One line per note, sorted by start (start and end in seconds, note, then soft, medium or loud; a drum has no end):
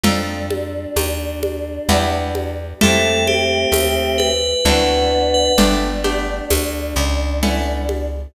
0.03 0.87 F2 loud
0.03 0.69 C4 medium
0.03 2.53 D4 medium
0.03 0.69 D#4 medium
0.03 0.69 F4 medium
0.03 0.69 A4 medium
0.03 low conga loud
0.50 high conga medium
0.96 1.79 D#2 medium
0.96 tambourine medium
0.96 high conga medium
1.43 high conga medium
1.89 2.73 E2 loud
1.89 2.54 B3 medium
1.89 2.54 D4 medium
1.89 2.54 E4 medium
1.89 2.54 G4 medium
1.89 low conga medium
2.35 high conga medium
2.81 3.66 F2 loud
2.81 3.46 A3 medium
2.81 4.31 A3 loud
2.81 4.31 C4 loud
2.81 3.46 E4 medium
2.81 3.46 F4 medium
2.81 3.46 G4 medium
2.81 3.23 A4 medium
2.81 low conga loud
3.27 4.17 G4 medium
3.27 high conga medium
3.72 4.55 D#2 medium
3.72 tambourine medium
3.72 high conga medium
4.18 5.30 B4 medium
4.18 high conga medium
4.65 5.50 D2 loud
4.65 5.52 B3 medium
4.65 5.30 C4 medium
4.65 5.30 D4 medium
4.65 5.52 D4 loud
4.65 5.30 E4 medium
4.65 5.30 F#4 medium
4.65 low conga medium
5.34 5.56 B4 medium
5.58 6.41 G1 medium
5.58 5.90 A3 medium
5.58 5.90 B3 medium
5.58 5.90 D4 medium
5.58 8.08 D4 medium
5.58 5.90 G4 medium
5.58 low conga medium
6.04 6.69 A3 medium
6.04 6.69 B3 medium
6.04 6.69 D4 medium
6.04 6.69 G4 medium
6.04 high conga medium
6.50 6.94 D2 medium
6.50 tambourine medium
6.50 high conga medium
6.96 8.27 C#2 loud
7.43 8.07 A3 medium
7.43 8.07 B3 medium
7.43 8.07 C#4 medium
7.43 8.07 E4 medium
7.43 low conga medium
7.89 high conga medium